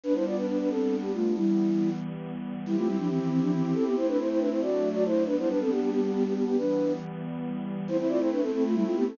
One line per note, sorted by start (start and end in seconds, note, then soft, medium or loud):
0.04 1.34 G3 medium
0.04 1.34 B3 medium
0.04 0.14 D4 medium
0.04 1.34 D4 medium
0.04 0.14 B4 medium
0.14 0.25 E4 medium
0.14 0.25 C5 medium
0.26 0.36 F4 medium
0.26 0.36 D5 medium
0.36 0.46 D4 medium
0.36 0.46 B4 medium
0.48 0.58 D4 medium
0.48 0.58 B4 medium
0.59 0.69 D4 medium
0.59 0.69 B4 medium
0.70 0.96 C4 medium
0.70 0.96 A4 medium
1.02 1.12 B3 medium
1.02 1.12 G4 medium
1.14 1.34 A3 medium
1.14 1.34 F4 medium
1.35 2.64 E3 medium
1.35 2.64 G3 medium
1.35 1.90 G3 medium
1.35 2.64 B3 medium
1.35 1.90 E4 medium
2.66 2.76 G3 medium
2.66 3.95 C4 medium
2.66 3.95 E4 medium
2.66 2.76 E4 medium
2.66 3.95 G4 medium
2.77 2.87 A3 medium
2.77 2.87 F4 medium
2.87 2.97 G3 medium
2.87 2.97 E4 medium
2.98 3.08 F3 medium
2.98 3.08 D4 medium
3.09 3.19 E3 medium
3.09 3.19 C4 medium
3.19 3.29 E3 medium
3.19 3.29 C4 medium
3.30 3.40 E3 medium
3.30 3.40 C4 medium
3.41 3.52 F3 medium
3.41 3.52 D4 medium
3.52 3.62 E3 medium
3.52 3.62 C4 medium
3.63 3.74 E3 medium
3.63 3.73 C4 medium
3.74 3.84 C4 medium
3.74 3.84 A4 medium
3.85 3.96 B3 medium
3.85 3.96 G4 medium
3.96 4.61 A3 medium
3.96 4.61 C4 medium
3.96 4.61 E4 medium
3.96 4.07 E4 medium
3.96 4.07 C5 medium
4.08 4.18 D4 medium
4.08 4.18 B4 medium
4.19 4.29 E4 medium
4.19 4.29 C5 medium
4.30 4.40 E4 medium
4.30 4.40 C5 medium
4.39 4.49 D4 medium
4.39 4.49 B4 medium
4.51 4.61 E4 medium
4.51 4.61 C5 medium
4.61 5.26 F#3 medium
4.61 5.26 A3 medium
4.61 5.26 D4 medium
4.61 4.89 F#4 medium
4.61 4.89 D5 medium
4.93 5.04 F#4 medium
4.93 5.04 D5 medium
5.06 5.24 E4 medium
5.06 5.24 C5 medium
5.26 6.56 G3 medium
5.26 6.56 B3 medium
5.26 5.36 D4 medium
5.26 6.56 D4 medium
5.26 5.36 B4 medium
5.38 5.49 E4 medium
5.38 5.49 C5 medium
5.49 5.59 D4 medium
5.49 5.59 B4 medium
5.60 5.71 C4 medium
5.60 5.71 A4 medium
5.70 5.80 B3 medium
5.70 5.80 G4 medium
5.81 5.90 B3 medium
5.81 5.90 G4 medium
5.90 6.01 B3 medium
5.90 6.01 G4 medium
6.01 6.12 B3 medium
6.01 6.12 G4 medium
6.13 6.23 B3 medium
6.13 6.23 G4 medium
6.25 6.34 B3 medium
6.25 6.34 G4 medium
6.34 6.45 B3 medium
6.34 6.45 G4 medium
6.47 6.57 B3 medium
6.47 6.57 G4 medium
6.57 7.86 E3 medium
6.57 7.86 G3 medium
6.57 7.86 B3 medium
6.57 6.92 D4 medium
6.57 6.92 B4 medium
7.87 9.16 A3 medium
7.87 9.16 C4 medium
7.87 9.16 E4 medium
7.87 7.97 E4 medium
7.87 7.97 C5 medium
7.98 8.08 E4 medium
7.98 8.08 C5 medium
8.09 8.19 F4 medium
8.09 8.19 D5 medium
8.19 8.30 E4 medium
8.19 8.30 C5 medium
8.32 8.42 D4 medium
8.32 8.42 B4 medium
8.41 8.51 C4 medium
8.41 8.51 A4 medium
8.53 8.63 C4 medium
8.53 8.63 A4 medium
8.65 8.75 A3 medium
8.65 8.75 F4 medium
8.74 8.84 G3 medium
8.74 8.84 E4 medium
8.85 8.95 A3 medium
8.85 8.95 F4 medium
8.95 9.06 B3 medium
8.95 9.06 G4 medium
9.07 9.17 C4 medium
9.07 9.17 A4 medium